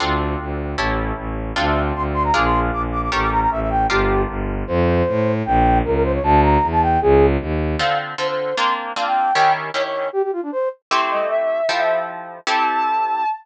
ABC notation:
X:1
M:2/2
L:1/8
Q:1/2=154
K:Dm
V:1 name="Flute"
z8 | z8 | f e2 z c' z c' b | d' c'2 z d' z d' d' |
^c' d' b b e e g2 | G4 z4 | [K:F] c8 | g4 B B c _d |
a2 b3 a g2 | _A3 z5 | [K:Dm] f2 z2 c c3 | c'2 z2 f g3 |
g2 z2 _d d3 | G G F D c2 z2 | [K:Am] z8 | z8 |
z8 |]
V:2 name="Ocarina"
z8 | z8 | z8 | z8 |
z8 | z8 | [K:F] z8 | z8 |
z8 | z8 | [K:Dm] z8 | z8 |
z8 | z8 | [K:Am] c' c' ^d2 e4 | f e2 z5 |
a8 |]
V:3 name="Orchestral Harp"
[CDFA]8 | [^CEGA]8 | [CDFA]8 | [DF_AB]8 |
[^CGAB]8 | [DFGB]8 | [K:F] z8 | z8 |
z8 | z8 | [K:Dm] [D,CFA]4 [D,CFA]4 | [B,CDF]4 [B,CDF]4 |
[_E,_D_FG]4 [E,DFG]4 | z8 | [K:Am] [A,CEG]8 | [F,EGA]8 |
[CEGA]8 |]
V:4 name="Violin" clef=bass
D,,4 D,,4 | A,,,4 A,,,4 | D,,4 D,,4 | B,,,4 B,,,4 |
A,,,4 A,,,4 | G,,,4 G,,,4 | [K:F] F,,4 A,,4 | B,,,4 _D,,4 |
D,,4 E,,4 | _D,,4 _E,,4 | [K:Dm] z8 | z8 |
z8 | z8 | [K:Am] z8 | z8 |
z8 |]